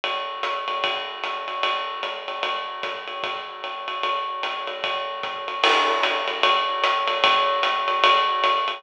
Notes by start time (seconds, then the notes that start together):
0.04 ride
0.43 hi-hat pedal, ride
0.68 ride
0.84 kick, ride
1.24 hi-hat pedal, ride
1.48 ride
1.63 ride
2.03 hi-hat pedal, ride
2.28 ride
2.43 ride
2.83 kick, hi-hat pedal, ride
3.08 ride
3.23 kick, ride
3.64 ride
3.88 ride
4.03 ride
4.43 hi-hat pedal, ride
4.67 ride
4.84 kick, ride
5.23 kick, hi-hat pedal, ride
5.48 ride
5.63 crash, ride
6.03 hi-hat pedal, ride
6.28 ride
6.43 ride
6.84 hi-hat pedal, ride
7.08 ride
7.24 kick, ride
7.63 hi-hat pedal, ride
7.88 ride
8.04 ride
8.44 hi-hat pedal, ride
8.68 ride